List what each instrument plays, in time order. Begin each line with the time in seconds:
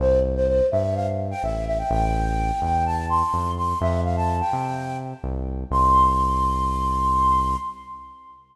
0.00 synth bass 1 C2, flute C5
0.36 flute C5
0.48 flute C5
0.71 synth bass 1 G2, flute E5
0.95 flute F5
1.31 flute G5
1.43 synth bass 1 A1, flute E5
1.67 flute E5
1.79 flute G5
1.90 synth bass 1 A1, flute G5
2.62 synth bass 1 E2, flute G5
2.86 flute A5
3.10 flute C6
3.33 synth bass 1 F2
3.57 flute C6
3.81 synth bass 1 F2, flute E5
4.05 flute F5
4.17 flute A5
4.40 flute G5
4.53 synth bass 1 C3
5.24 synth bass 1 C2
5.71 synth bass 1 C2, flute C6